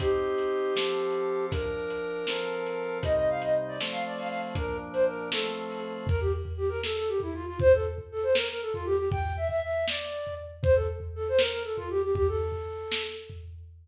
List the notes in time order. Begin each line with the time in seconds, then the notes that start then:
0.00 C4 D#4 G4, kick, closed hi-hat
0.38 closed hi-hat
0.75 F3 C4 A4, snare
1.12 closed hi-hat
1.51 F3 D4 A#4, kick, closed hi-hat
1.90 closed hi-hat
2.27 F3 C4 A4, snare
2.66 closed hi-hat
3.03 C3 G3 D#4 D#5, kick, closed hi-hat
3.17 D#5
3.30 F5
3.42 D#5, closed hi-hat
3.68 D5
3.81 F3 A3 C4, snare
3.92 F5
4.06 D5
4.18 F5, open hi-hat
4.29 F5
4.55 A#2 F3 D4 A#4, kick, closed hi-hat
4.93 C5, closed hi-hat
5.07 A#4
5.32 F3 A3 C4 A4, snare
5.70 open hi-hat
6.07 A#4, kick, floor tom
6.20 G4
6.45 floor tom
6.57 G4
6.69 A#4
6.83 A4, snare
6.96 A4
7.08 G4
7.20 E4, floor tom
7.34 F4
7.46 F4
7.59 C5, kick, floor tom
7.74 A4
7.98 floor tom
8.12 A4
8.23 C5
8.35 A#4, snare
8.49 A#4
8.62 A4
8.73 F4, floor tom
8.85 G4
8.97 G4
9.11 G5, kick, floor tom
9.37 E5
9.48 E5, floor tom
9.63 E5
9.88 D5, snare
10.27 floor tom
10.63 C5, kick, floor tom
10.75 A4
11.00 floor tom
11.15 A4
11.28 C5
11.38 A#4, snare
11.51 A#4
11.64 A4
11.76 F4, floor tom
11.90 G4
12.03 G4
12.15 G4, kick, floor tom
12.28 A4
12.52 floor tom
12.92 snare
13.30 floor tom